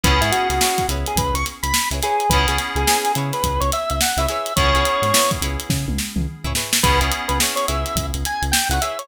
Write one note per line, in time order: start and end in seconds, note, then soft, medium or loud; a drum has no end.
0.04 0.20 C#2 loud
0.04 2.09 B3 medium
0.04 2.09 C#4 loud
0.04 2.09 E4 medium
0.04 0.18 E4 medium
0.04 2.09 G#4 loud
0.04 0.18 G#4 medium
0.04 0.21 B4 loud
0.04 0.18 B4 medium
0.04 0.18 C#5 medium
0.04 kick loud
0.04 closed hi-hat loud
0.21 0.31 G#2 medium
0.21 0.31 E4 loud
0.21 0.54 E4 medium
0.21 0.54 G#4 medium
0.21 0.54 B4 medium
0.21 0.54 C#5 medium
0.21 snare soft
0.21 closed hi-hat medium
0.31 0.48 F#4 loud
0.31 closed hi-hat loud
0.50 0.59 C#2 medium
0.50 0.87 F#4 medium
0.50 snare soft
0.50 closed hi-hat medium
0.61 0.85 E4 medium
0.61 0.85 G#4 medium
0.61 0.85 B4 medium
0.61 0.85 C#5 medium
0.61 snare loud
0.78 kick medium
0.78 snare soft
0.78 closed hi-hat medium
0.89 1.04 C#2 medium
0.89 1.37 E4 medium
0.89 1.37 G#4 medium
0.89 1.37 B4 medium
0.89 1.37 C#5 medium
0.89 closed hi-hat medium
1.06 1.18 G#4 loud
1.06 closed hi-hat medium
1.16 1.32 C#2 medium
1.16 1.35 B4 loud
1.16 kick loud
1.16 closed hi-hat loud
1.34 1.44 C#2 medium
1.34 1.45 C#6 loud
1.34 closed hi-hat medium
1.46 snare soft
1.46 closed hi-hat medium
1.63 1.73 C#2 medium
1.63 1.88 B5 loud
1.63 closed hi-hat medium
1.74 snare loud
1.91 2.01 C#2 medium
1.91 2.00 E4 medium
1.91 2.00 G#4 medium
1.91 2.00 B4 medium
1.91 2.00 C#5 medium
1.91 closed hi-hat medium
2.02 2.26 E4 medium
2.02 2.26 G#4 medium
2.02 2.30 G#4 loud
2.02 2.26 B4 medium
2.02 2.26 C#5 medium
2.02 snare soft
2.02 closed hi-hat medium
2.20 closed hi-hat medium
2.30 2.45 C#2 loud
2.30 4.37 B3 medium
2.30 4.37 C#4 medium
2.30 2.45 E4 medium
2.30 4.37 E4 loud
2.30 2.45 G#4 medium
2.30 4.37 G#4 loud
2.30 2.46 B4 loud
2.30 2.45 B4 medium
2.30 2.45 C#5 medium
2.30 kick loud
2.30 closed hi-hat loud
2.48 2.58 C#2 medium
2.48 2.81 E4 medium
2.48 2.58 G#4 medium
2.48 2.81 G#4 medium
2.48 2.81 B4 medium
2.48 2.81 C#5 medium
2.48 closed hi-hat medium
2.58 snare soft
2.58 closed hi-hat medium
2.75 2.85 C#2 loud
2.75 3.12 G#4 loud
2.75 closed hi-hat medium
2.87 3.11 E4 medium
2.87 3.11 G#4 medium
2.87 3.11 B4 medium
2.87 3.11 C#5 medium
2.87 snare loud
3.05 closed hi-hat medium
3.15 3.31 C#3 loud
3.15 3.64 E4 medium
3.15 3.64 G#4 medium
3.15 3.64 B4 medium
3.15 3.64 C#5 medium
3.15 closed hi-hat medium
3.33 3.61 B4 medium
3.33 snare soft
3.33 closed hi-hat medium
3.43 3.59 C#2 medium
3.43 kick medium
3.43 closed hi-hat loud
3.60 3.71 C#2 loud
3.60 3.71 C#5 loud
3.60 closed hi-hat medium
3.72 3.90 E5 loud
3.72 snare soft
3.72 closed hi-hat medium
3.90 4.00 C#2 medium
3.90 4.01 E5 loud
3.90 closed hi-hat medium
4.01 4.18 F#5 medium
4.01 snare loud
4.17 4.26 C#2 loud
4.17 4.27 E4 medium
4.17 4.27 G#4 medium
4.17 4.27 B4 medium
4.17 4.27 C#5 medium
4.17 4.27 E5 loud
4.17 closed hi-hat medium
4.28 4.53 E4 medium
4.28 4.53 G#4 medium
4.28 4.53 B4 medium
4.28 4.53 C#5 medium
4.28 4.54 E5 loud
4.28 snare soft
4.28 closed hi-hat medium
4.46 closed hi-hat medium
4.56 4.73 C#2 loud
4.56 6.62 B3 medium
4.56 6.62 C#4 medium
4.56 6.62 E4 medium
4.56 4.71 E4 medium
4.56 6.62 G#4 loud
4.56 4.71 G#4 medium
4.56 4.71 B4 medium
4.56 5.31 C#5 loud
4.56 4.71 C#5 medium
4.56 kick loud
4.56 closed hi-hat loud
4.74 4.84 C#2 loud
4.74 5.07 E4 medium
4.74 5.07 G#4 medium
4.74 5.07 B4 medium
4.74 5.07 C#5 medium
4.74 closed hi-hat medium
4.85 closed hi-hat medium
5.02 5.12 G#2 medium
5.02 snare soft
5.02 closed hi-hat medium
5.14 5.38 E4 medium
5.14 5.38 G#4 medium
5.14 5.38 B4 medium
5.14 5.38 C#5 medium
5.14 snare loud
5.31 kick loud
5.31 closed hi-hat medium
5.41 5.57 C#2 medium
5.41 5.90 E4 medium
5.41 5.90 G#4 medium
5.41 5.90 B4 medium
5.41 5.90 C#5 medium
5.41 closed hi-hat medium
5.60 closed hi-hat medium
5.69 5.85 C#3 loud
5.69 kick loud
5.69 snare medium
5.88 5.98 C#2 medium
5.88 high tom medium
5.98 snare medium
6.16 6.26 C#2 medium
6.16 mid tom loud
6.44 6.54 C#2 medium
6.44 6.53 E4 medium
6.44 6.53 G#4 medium
6.44 6.53 B4 medium
6.44 6.53 C#5 medium
6.44 floor tom medium
6.55 6.79 E4 medium
6.55 6.79 G#4 medium
6.55 6.79 B4 medium
6.55 6.79 C#5 medium
6.55 snare loud
6.73 snare loud
6.83 7.00 C#2 loud
6.83 8.88 B3 loud
6.83 8.88 C#4 medium
6.83 8.88 E4 medium
6.83 6.98 E4 medium
6.83 8.88 G#4 loud
6.83 6.98 G#4 medium
6.83 7.00 B4 loud
6.83 6.98 B4 medium
6.83 6.98 C#5 medium
6.83 kick loud
6.83 closed hi-hat loud
7.01 7.11 C#2 loud
7.01 7.34 E4 medium
7.01 7.34 G#4 medium
7.01 7.34 B4 medium
7.01 7.34 C#5 medium
7.01 closed hi-hat medium
7.12 closed hi-hat medium
7.28 7.39 C#2 medium
7.28 7.38 B4 medium
7.28 closed hi-hat medium
7.40 7.64 E4 medium
7.40 7.64 G#4 medium
7.40 7.64 B4 medium
7.40 7.64 C#5 medium
7.40 snare loud
7.56 7.66 C#5 loud
7.56 closed hi-hat medium
7.68 7.84 C#2 medium
7.68 8.16 E4 medium
7.68 8.16 G#4 medium
7.68 8.16 B4 medium
7.68 8.16 C#5 medium
7.68 8.06 E5 medium
7.68 closed hi-hat medium
7.86 closed hi-hat medium
7.96 8.11 C#2 medium
7.96 kick loud
7.96 closed hi-hat loud
8.14 8.24 C#2 medium
8.14 closed hi-hat medium
8.25 8.43 G#5 loud
8.25 closed hi-hat medium
8.42 8.52 C#2 loud
8.42 closed hi-hat medium
8.52 8.68 G5 loud
8.52 snare loud
8.69 8.79 C#2 loud
8.69 8.79 E4 medium
8.69 8.79 G#4 medium
8.69 8.79 B4 medium
8.69 8.81 F#5 loud
8.69 closed hi-hat medium
8.73 8.79 C#5 medium
8.81 9.06 E4 medium
8.81 9.06 G#4 medium
8.81 9.06 B4 medium
8.81 9.06 C#5 medium
8.81 8.98 E5 loud
8.81 closed hi-hat medium
8.99 9.08 C#5 loud
8.99 closed hi-hat medium